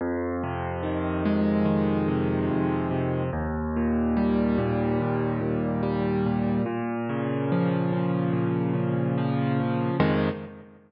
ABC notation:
X:1
M:4/4
L:1/8
Q:1/4=72
K:Fm
V:1 name="Acoustic Grand Piano" clef=bass
F,, C, E, A, E, C, F,, C, | E,, B,, G, B,, E,, B,, G, B,, | B,, D, F, D, B,, D, F, D, | [F,,C,E,A,]2 z6 |]